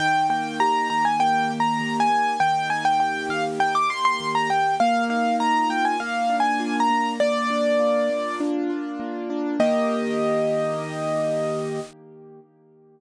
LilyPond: <<
  \new Staff \with { instrumentName = "Acoustic Grand Piano" } { \time 4/4 \key ees \major \tempo 4 = 100 g''8 g''8 bes''8 bes''16 aes''16 \tuplet 3/2 { g''4 bes''4 aes''4 } | g''8 aes''16 g''16 g''8 f''16 r16 g''16 d'''16 c'''16 c'''8 bes''16 g''8 | f''8 f''8 bes''8 g''16 aes''16 \tuplet 3/2 { f''4 aes''4 bes''4 } | d''2 r2 |
ees''1 | }
  \new Staff \with { instrumentName = "Acoustic Grand Piano" } { \time 4/4 \key ees \major ees8 bes8 g'8 ees8 bes8 g'8 ees8 bes8 | ees8 bes8 g'8 ees8 bes8 g'8 ees8 bes8 | bes8 ees'8 f'8 bes8 bes8 d'8 f'8 bes8 | bes8 d'8 f'8 bes8 d'8 f'8 bes8 d'8 |
<ees bes g'>1 | }
>>